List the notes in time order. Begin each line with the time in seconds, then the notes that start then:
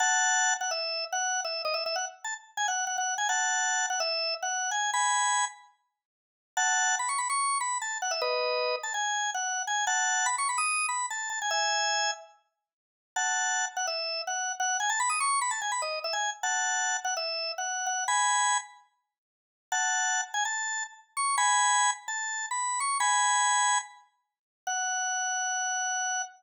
0.00 F#5 A5
0.61 F#5
0.71 E5
1.13 F#5
1.45 E5
1.65 D#5
1.74 E5
1.86 E5
1.96 F#5
2.24 A5
2.57 G#5
2.68 F#5
2.87 F#5
2.98 F#5
3.18 G#5
3.29 F#5 A5
3.90 F#5
4.00 E5
4.42 F#5
4.71 G#5
4.93 G#5 B5
6.57 F#5 A5
6.99 B5
7.09 C#6
7.18 B5
7.30 C#6
7.61 B5
7.82 A5
8.02 F#5
8.11 E5
8.21 B4 D#5
8.83 A5
8.94 G#5
9.34 F#5
9.67 G#5
9.87 F#5 A5
10.26 B5
10.38 C#6
10.49 B5
10.58 D#6
10.89 B5
11.10 A5
11.30 A5
11.42 G#5
11.51 E5 G#5
13.16 F#5 A5
13.77 F#5
13.87 E5
14.27 F#5
14.60 F#5
14.80 G#5
14.90 A5
15.00 B5
15.10 D#6
15.20 C#6
15.41 B5
15.51 A5
15.62 G#5
15.72 B5
15.82 D#5
16.04 E5
16.13 G#5
16.43 F#5 A5
17.05 F#5
17.17 E5
17.58 F#5
17.86 F#5
18.08 G#5 B5
19.72 F#5 A5
20.34 G#5
20.45 A5
21.17 C#6
21.38 G#5 B5
22.08 A5
22.51 B5
22.80 C#6
23.00 G#5 B5
24.67 F#5